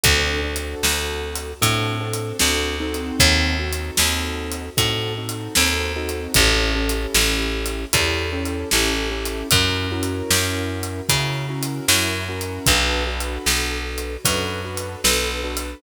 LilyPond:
<<
  \new Staff \with { instrumentName = "Acoustic Grand Piano" } { \time 4/4 \key a \major \tempo 4 = 76 <c' d' fis' a'>8 <c' d' fis' a'>4. <c' d' fis' a'>8 <c' d' fis' a'>8 <c' d' fis' a'>8 <c' dis' fis' a'>8~ | <c' dis' fis' a'>8 <c' dis' fis' a'>4. <c' dis' fis' a'>8 <c' dis' fis' a'>8 <c' dis' fis' a'>8 <c' dis' fis' a'>8 | <cis' e' g' a'>8 <cis' e' g' a'>4. <cis' e' g' a'>8 <cis' e' g' a'>8 <cis' e' g' a'>8 <cis' e' g' a'>8 | <cis' e' fis' ais'>8 <cis' e' fis' ais'>4. <cis' e' fis' ais'>8 <cis' e' fis' ais'>8 <cis' e' fis' ais'>8 <cis' e' fis' ais'>8 |
<d' fis' a' b'>8 <d' fis' a' b'>4. <d' fis' a' b'>8 <d' fis' a' b'>8 <d' fis' a' b'>8 <d' fis' a' b'>8 | }
  \new Staff \with { instrumentName = "Electric Bass (finger)" } { \clef bass \time 4/4 \key a \major d,4 d,4 a,4 d,4 | dis,4 dis,4 a,4 dis,4 | a,,4 a,,4 e,4 a,,4 | fis,4 fis,4 cis4 fis,4 |
b,,4 b,,4 fis,4 b,,4 | }
  \new DrumStaff \with { instrumentName = "Drums" } \drummode { \time 4/4 \tuplet 3/2 { <hh bd>8 r8 hh8 sn8 r8 hh8 <hh bd>8 r8 hh8 sn8 r8 hh8 } | \tuplet 3/2 { <hh bd>8 r8 hh8 sn8 r8 hh8 <hh bd>8 r8 hh8 sn8 r8 hh8 } | \tuplet 3/2 { <hh bd>8 r8 hh8 sn8 r8 hh8 <hh bd>8 r8 hh8 sn8 r8 hh8 } | \tuplet 3/2 { <hh bd>8 r8 hh8 sn8 r8 hh8 <hh bd>8 r8 hh8 sn8 r8 hh8 } |
\tuplet 3/2 { <hh bd>8 r8 hh8 sn8 r8 hh8 <hh bd>8 r8 hh8 sn8 r8 hh8 } | }
>>